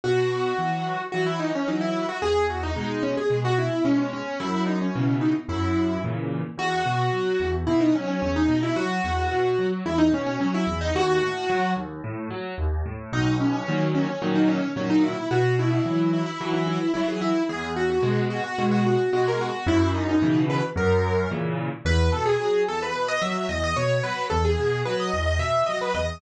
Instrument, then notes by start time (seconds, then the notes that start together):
acoustic grand piano
0.04 B2 F#4
0.58 E3 F#3
1.12 E3 F#3 F#4
1.26 E4
1.39 D#4
1.55 C#4
1.67 E3 F#3 D#4
1.81 E4
2.09 F#4
2.22 E2 G#4
2.50 F#4
2.63 D#4
2.76 B2 G#3
3.03 C#4
3.17 G#4
3.30 B2 G#3
3.44 F#4
3.58 E4
3.84 B2 G#3 C#4
3.98 C#4
4.13 C#4
4.40 F#2 E4
4.66 D#4
4.81 C#4
4.95 B2 C#3 E3
5.21 D#4
5.48 F#2 E4
6.04 A#2 C#3 E3
6.57 E2 F#4
6.86 B2
7.12 F#3
7.40 E2
7.67 B2 E4
7.81 D#4
7.95 F#3 C#4
8.08 C#4
8.22 E2 C#4
8.36 D#4
8.48 B2
8.63 E4
8.76 F#3 F#4
9.04 E2
9.31 B2
9.58 F#3
9.85 E2 E4
9.98 D#4
10.12 B2 C#4
10.26 C#4
10.40 F#3 C#4
10.54 E4
10.67 E2
10.81 D#4
10.95 D#2 F#4
11.21 A2
11.49 F#3
11.76 D#2
12.04 A2
12.30 F#3
12.58 D#2
12.85 A2
13.12 B1 D#4
13.40 C#4
13.53 C#4
13.68 A#2 D#3 F#3
13.95 C#4
14.08 C#4
14.22 A#2 D#3 F#3
14.35 D#4
14.48 C#4
14.76 A#2 D#3 F#3 C#4
14.90 D#4
15.03 E4
15.31 B2 F#4
15.59 E4
15.71 E4
15.85 E3 F#3
16.13 E4
16.26 E4
16.40 E3 F#3
16.53 E4
16.67 E4
16.94 E3 F#3 E4
17.08 G#4
17.21 E4
17.49 E2 G#4
17.76 F#4
17.90 F#4
18.02 B2 G#3
18.30 F#4
18.44 F#4
18.58 B2 G#3
18.71 F#4
18.86 F#4
19.12 B2 G#3 F#4
19.28 A#4
19.41 F#4
19.66 F#2 E4
19.94 D#4
20.09 D#4
20.22 B2 C#3 E3
20.50 B4
20.76 F#2 A#4
21.31 A#2 C#3 E3
21.85 E2 B4
22.12 B2 A4
22.25 G#4
22.39 F#3
22.68 E2 A4
22.82 B4
22.95 B2
23.08 D#5
23.21 F#3 E5
23.49 E2 D#5
23.64 D#5
23.76 B2 C#5
24.03 F#3 B4
24.30 E2 A4
24.45 G#4
24.58 B2
24.85 F#3 B4
25.00 D#5
25.13 E2
25.26 D#5
25.39 B2 E5
25.66 F#3 D#5
25.81 B4
25.94 E2 D#5